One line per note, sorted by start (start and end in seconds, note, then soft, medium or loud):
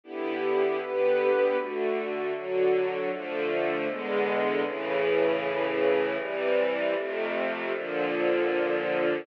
0.04 0.80 D3 medium
0.04 0.80 B3 medium
0.04 0.80 E4 medium
0.04 0.80 G4 medium
0.80 1.57 D3 medium
0.80 1.57 B3 medium
0.80 1.57 G4 medium
0.80 1.57 B4 medium
1.57 2.33 D3 medium
1.57 2.33 A3 medium
1.57 2.33 F#4 medium
2.34 3.10 D3 medium
2.34 3.10 F#3 medium
2.34 3.10 F#4 medium
3.11 3.87 D3 loud
3.11 3.88 F3 medium
3.11 3.88 A3 medium
3.88 4.64 E2 medium
3.88 4.64 D3 medium
3.88 4.64 G#3 loud
3.88 4.64 B3 medium
4.65 6.17 A2 loud
4.65 6.17 C#3 loud
4.65 6.17 E3 loud
6.19 6.95 C3 medium
6.19 6.95 E3 loud
6.19 6.95 G3 medium
6.96 7.72 F2 loud
6.96 7.72 C3 loud
6.96 7.72 A3 medium
7.73 9.25 A#2 medium
7.73 9.25 D3 medium
7.73 9.25 F3 medium